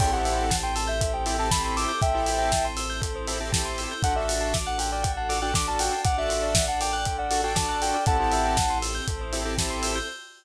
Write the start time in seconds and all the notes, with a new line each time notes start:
0.00 A1 C4 E4 G4 A4 G5, kick, crash
0.13 C4 E4 G4 A4 C5 F#5
0.25 E5, open hi-hat
0.38 G5
0.50 A5, kick, snare
0.63 G5 C6
0.75 A5 E6, open hi-hat
0.87 E5 G6
1.01 A4, kick, closed hi-hat
1.13 C5 G5
1.26 C4 E4 G4 A4 E5, open hi-hat
1.38 C4 E4 G4 A4 G5 A5
1.51 C4 E4 G4 A4 A5 B5, kick, snare
1.64 B5 C6
1.76 D6 E6, open hi-hat
1.88 G6
2.01 A1 C4 E4 A4 C5 E5 G5, kick, closed hi-hat
2.14 C4 E4 G4 A4 C5
2.26 E5, open hi-hat
2.39 G5
2.52 A5, kick, snare
2.65 C6
2.77 E6, open hi-hat
2.90 G6
3.02 A4, kick, closed hi-hat
3.16 C5
3.27 C4 E4 G4 A4 E5, open hi-hat
3.40 C4 E4 G4 A4 G5
3.52 C4 E4 G4 A4 A5, kick, snare
3.65 C6
3.78 E6, open hi-hat
3.91 G6
4.03 A1 D4 F#4 A4 F#5, kick, closed hi-hat
4.15 D4 F#4 A4 D5 E5
4.28 F#5, open hi-hat
4.41 A5
4.54 D6, kick, snare
4.66 F#5 F#6
4.78 A4 G5, open hi-hat
4.91 D5 G5
5.03 F#5, kick, closed hi-hat
5.17 F#5 A5
5.29 D4 F#4 A4 D6, open hi-hat
5.42 D4 F#4 A4 G5 F#6
5.54 D4 F#4 A4 D6, kick, snare
5.68 D5 A5
5.79 F#5 G5, open hi-hat
5.92 A5
6.04 A1 D4 A4 D5 F#5 D6, kick, closed hi-hat
6.18 D4 F#4 A4 E5 F#6
6.29 A4, open hi-hat
6.43 D5
6.55 F#5, kick, snare
6.68 F#5 A5
6.81 G5 D6, open hi-hat
6.93 G5 F#6
7.05 A4, kick, closed hi-hat
7.18 D5 F#5
7.31 D4 F#4 A4 F#5, open hi-hat
7.43 D4 F#4 A4 G5 A5
7.55 D4 F#4 A4 A5 D6, kick, snare
7.69 A5 F#6
7.82 A4 G5, open hi-hat
7.94 D5
8.06 A1 C4 E4 G4 A4 F#5 A5, kick, closed hi-hat
8.19 C4 E4 G4 A4 C5
8.32 E5, open hi-hat
8.45 G5
8.57 A5, kick, snare
8.70 C6
8.82 E6, open hi-hat
8.95 G6
9.08 A1 C4 E4 A4 C5, kick, closed hi-hat
9.21 C5
9.33 C4 E4 G4 A4 E5, open hi-hat
9.45 C4 E4 G4 A4 G5
9.58 C4 E4 G4 A4 A5, kick, snare
9.70 C6
9.82 E6, open hi-hat
9.95 G6